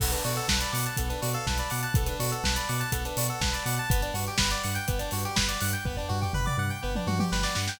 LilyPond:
<<
  \new Staff \with { instrumentName = "Electric Piano 2" } { \time 4/4 \key b \minor \tempo 4 = 123 b16 d'16 fis'16 a'16 b'16 d''16 fis''16 a''16 b16 d'16 fis'16 a'16 b'16 d''16 fis''16 a''16 | b16 d'16 fis'16 a'16 b'16 d''16 fis''16 a''16 b16 d'16 fis'16 a'16 b'16 d''16 fis''16 a''16 | b16 d'16 fis'16 g'16 b'16 d''16 fis''16 g''16 b16 d'16 fis'16 g'16 b'16 d''16 fis''16 g''16 | b16 d'16 fis'16 g'16 b'16 d''16 fis''16 g''16 b16 d'16 fis'16 g'16 b'16 d''16 fis''16 g''16 | }
  \new Staff \with { instrumentName = "Lead 1 (square)" } { \time 4/4 \key b \minor a'16 b'16 d''16 fis''16 a''16 b''16 d'''16 fis'''16 a'16 b'16 d''16 f''16 a''16 b''16 d'''16 fis'''16 | a'16 b'16 d''16 fis''16 a''16 b''16 d'''16 fis'''16 a'16 b'16 d''16 fis''16 a''16 b''16 d'''16 fis'''16 | b'16 d''16 fis''16 g''16 b''16 d'''16 fis'''16 g'''16 b'16 d''16 fis''16 g''16 b''16 d'''16 fis'''16 g'''16 | b'16 d''16 fis''16 g''16 b''16 d'''16 fis'''16 g'''16 b'16 d''16 fis''16 g''16 b''16 d'''16 fis'''16 g'''16 | }
  \new Staff \with { instrumentName = "Synth Bass 2" } { \clef bass \time 4/4 \key b \minor b,,8 b,8 b,,8 b,8 b,,8 b,8 b,,8 b,8 | b,,8 b,8 b,,8 b,8 b,,8 b,8 b,,8 b,8 | g,,8 g,8 g,,8 g,8 g,,8 g,8 g,,8 g,8 | g,,8 g,8 g,,8 g,8 g,,8 g,8 g,,8 g,8 | }
  \new DrumStaff \with { instrumentName = "Drums" } \drummode { \time 4/4 <cymc bd>16 hh16 hho16 hh16 <bd sn>16 hh16 hho16 hh16 <hh bd>16 hh16 hho16 hh16 <bd sn>16 hh16 hho16 hh16 | <hh bd>16 hh16 hho16 hh16 <bd sn>16 hh16 hho16 hh16 <hh bd>16 hh16 hho16 hh16 <bd sn>16 hh16 hho16 hh16 | <hh bd>16 hh16 hho16 hh16 <bd sn>16 hh16 hho16 hh16 <hh bd>16 hh16 hho16 hh16 <bd sn>16 hh16 hho16 hh16 | <bd tomfh>16 tomfh16 tomfh16 tomfh16 toml16 toml8. r16 tommh16 tommh16 tommh16 sn16 sn16 sn16 sn16 | }
>>